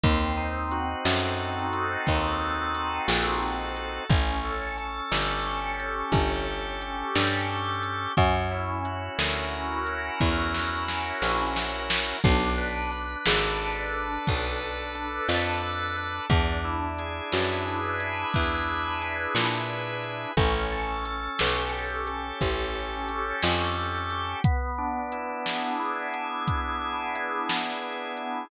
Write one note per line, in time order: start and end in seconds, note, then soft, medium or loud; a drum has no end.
0.04 0.95 D#2 loud
0.04 1.39 C4 loud
0.04 kick loud
0.04 closed hi-hat loud
0.37 1.73 D#4 medium
0.71 2.07 F#4 loud
0.71 closed hi-hat medium
1.05 1.97 F#2 loud
1.05 2.40 A4 medium
1.05 snare loud
1.39 2.74 C4 medium
1.73 3.08 D#4 loud
1.73 closed hi-hat medium
2.07 3.00 D#2 medium
2.07 3.42 F#4 medium
2.07 kick loud
2.07 closed hi-hat loud
2.41 3.76 A4 medium
2.75 4.04 C4 medium
2.75 closed hi-hat medium
3.08 4.00 A#1 loud
3.08 4.05 D#4 medium
3.08 snare loud
3.42 4.07 F#4 medium
3.76 4.09 A4 medium
3.76 closed hi-hat medium
4.09 5.01 A1 loud
4.09 4.77 C#4 loud
4.09 kick loud
4.09 closed hi-hat loud
4.44 5.79 A4 medium
4.78 5.46 C#4 medium
4.78 closed hi-hat medium
5.12 6.03 G1 medium
5.12 6.13 G4 medium
5.12 snare loud
5.46 6.47 C#4 loud
5.79 7.15 A4 medium
5.79 closed hi-hat medium
6.12 7.04 G1 loud
6.12 7.83 G4 loud
6.12 kick loud
6.12 closed hi-hat loud
6.48 6.81 C#4 medium
6.81 7.49 C#4 medium
6.81 closed hi-hat medium
7.15 8.07 G2 loud
7.15 8.12 A4 medium
7.15 snare loud
7.49 8.14 C#4 medium
7.83 8.15 G4 medium
7.83 closed hi-hat medium
8.17 9.09 F#2 loud
8.17 9.52 C#4 loud
8.17 kick loud
8.17 closed hi-hat loud
8.51 9.86 E4 medium
8.85 10.19 F#4 medium
8.85 closed hi-hat medium
9.19 10.10 D2 medium
9.19 10.54 A#4 medium
9.19 snare loud
9.53 10.88 C#4 medium
9.87 11.22 E4 medium
9.87 closed hi-hat medium
10.20 11.12 E2 loud
10.20 11.56 F#4 medium
10.20 kick loud
10.54 11.89 A#4 medium
10.54 snare loud
10.88 12.17 C#4 loud
10.88 snare loud
11.22 12.13 A#1 medium
11.22 12.19 E4 medium
11.22 snare loud
11.56 12.20 F#4 loud
11.56 snare loud
11.90 12.22 A#4 medium
11.90 snare loud
12.24 13.16 B1 loud
12.24 12.91 D4 loud
12.24 kick loud
12.24 crash loud
12.58 13.93 B4 medium
12.92 13.59 D4 medium
12.92 closed hi-hat medium
13.26 14.18 G#1 loud
13.26 14.26 A4 medium
13.26 snare loud
13.60 14.61 D4 loud
13.93 15.28 B4 medium
13.93 closed hi-hat medium
14.27 15.20 B1 medium
14.27 15.96 A4 loud
14.27 kick loud
14.27 closed hi-hat loud
14.61 14.94 D4 medium
14.95 15.62 D4 medium
14.95 closed hi-hat medium
15.29 16.20 F2 medium
15.29 16.25 B4 medium
15.29 snare loud
15.63 16.27 D4 medium
15.97 16.29 A4 medium
15.97 closed hi-hat medium
16.30 17.21 E2 loud
16.30 17.66 D4 loud
16.30 kick loud
16.30 closed hi-hat loud
16.65 18.00 E4 medium
16.98 18.33 G#4 medium
16.98 closed hi-hat medium
17.32 18.25 F#2 medium
17.32 18.67 B4 medium
17.32 snare loud
17.66 19.02 D4 medium
18.00 19.35 E4 medium
18.00 closed hi-hat medium
18.34 19.27 E2 medium
18.34 19.69 G#4 medium
18.34 kick loud
18.34 closed hi-hat loud
18.68 20.03 B4 loud
19.02 20.31 D4 medium
19.02 closed hi-hat medium
19.35 20.26 A#2 medium
19.35 20.32 E4 medium
19.35 snare loud
19.69 20.34 G#4 medium
20.03 20.35 B4 medium
20.03 closed hi-hat medium
20.37 21.29 A1 loud
20.37 21.05 C#4 loud
20.37 kick loud
20.37 closed hi-hat loud
20.72 22.07 A4 medium
21.05 21.72 C#4 medium
21.05 closed hi-hat medium
21.39 22.32 B1 medium
21.39 22.40 G4 medium
21.39 snare loud
21.73 22.74 C#4 medium
22.07 23.42 A4 loud
22.07 closed hi-hat medium
22.41 23.33 A1 medium
22.41 24.10 G4 medium
22.41 kick medium
22.41 closed hi-hat loud
22.75 23.08 C#4 medium
23.09 23.76 C#4 loud
23.09 closed hi-hat medium
23.43 24.35 F2 loud
23.43 24.39 A4 medium
23.43 snare loud
23.77 24.41 C#4 medium
24.10 24.43 G4 medium
24.10 closed hi-hat medium
24.44 25.79 B3 loud
24.44 kick loud
24.44 closed hi-hat loud
24.78 26.13 D4 loud
25.12 26.47 E4 medium
25.12 closed hi-hat medium
25.46 26.81 G#4 medium
25.46 snare loud
25.79 27.15 B3 medium
26.14 27.49 D4 medium
26.14 closed hi-hat medium
26.48 27.83 E4 medium
26.48 kick loud
26.48 closed hi-hat loud
26.81 28.17 G#4 medium
27.15 28.44 B3 loud
27.15 closed hi-hat medium
27.49 28.46 D4 medium
27.49 snare loud
27.83 28.48 E4 medium
28.17 28.49 G#4 medium
28.17 closed hi-hat medium